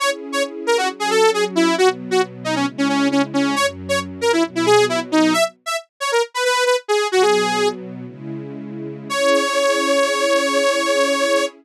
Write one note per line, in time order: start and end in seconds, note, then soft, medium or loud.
0.00 0.88 C#4 medium
0.00 0.88 E4 medium
0.00 0.88 G#4 medium
0.00 0.10 C#5 loud
0.32 0.43 C#5 loud
0.67 0.77 A#4 loud
0.78 0.88 F#4 loud
0.89 1.76 F#3 medium
0.89 1.77 C#4 medium
0.89 1.77 F#4 medium
1.00 1.10 G#4 loud
1.10 1.30 A4 loud
1.34 1.44 G#4 loud
1.56 1.75 E4 loud
1.77 2.65 B2 medium
1.77 2.65 F#3 medium
1.77 2.65 B3 medium
1.77 1.89 F#4 loud
2.11 2.21 F#4 loud
2.44 2.55 D#4 loud
2.55 2.66 C#4 loud
2.66 3.54 C#3 medium
2.66 3.54 G#3 medium
2.66 3.54 E4 medium
2.78 2.88 C#4 loud
2.89 3.08 C#4 loud
3.11 3.22 C#4 loud
3.34 3.55 C#4 medium
3.55 4.43 F#2 medium
3.55 4.43 F#3 medium
3.55 4.43 C#4 medium
3.55 3.66 C#5 loud
3.89 3.99 C#5 loud
4.21 4.32 A#4 loud
4.33 4.43 E4 loud
4.45 5.33 B2 medium
4.45 5.33 F#3 medium
4.45 5.33 B3 medium
4.55 4.66 E4 medium
4.66 4.85 G#4 loud
4.89 5.00 E4 loud
5.12 5.33 D#4 loud
5.33 5.44 E5 loud
5.66 5.76 E5 medium
6.00 6.11 C#5 loud
6.12 6.22 A#4 loud
6.34 6.44 B4 loud
6.45 6.64 B4 loud
6.66 6.76 B4 loud
6.88 7.07 G#4 loud
7.12 8.05 B2 medium
7.12 8.05 F#3 medium
7.12 8.05 B3 medium
7.12 7.22 F#4 loud
7.22 7.68 G#4 loud
8.05 9.09 C#3 medium
8.05 9.09 G#3 medium
8.05 9.09 E4 medium
9.09 11.46 C#4 loud
9.09 11.46 E4 loud
9.09 11.46 G#4 loud
9.09 11.45 C#5 loud